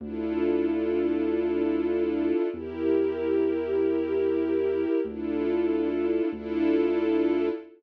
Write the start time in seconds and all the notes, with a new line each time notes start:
0.00 D2 D4 E4
0.05 F4 A4
2.53 E2 E4 G4
2.58 A#4
5.05 D2 D4 E4
5.11 F4 A4
6.32 D2 D4 E4
6.37 F4 A4